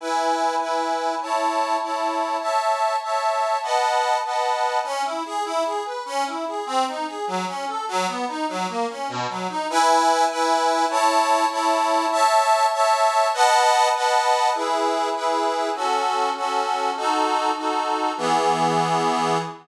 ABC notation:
X:1
M:6/8
L:1/8
Q:3/8=99
K:E
V:1 name="Accordion"
[EBg]3 [EBg]3 | [Eca]3 [Eca]3 | [cea]3 [cea]3 | [Bdfa]3 [Bdfa]3 |
[K:C#m] C E G E G B | C E G ^B, D G | F, C A F, B, D | F, ^A, C B,, F, D |
[K:E] [EBg]3 [EBg]3 | [Eca]3 [Eca]3 | [cea]3 [cea]3 | [Bdfa]3 [Bdfa]3 |
[EGB]3 [EGB]3 | [CFA]3 [CFA]3 | [DFA]3 [DFA]3 | [E,B,G]6 |]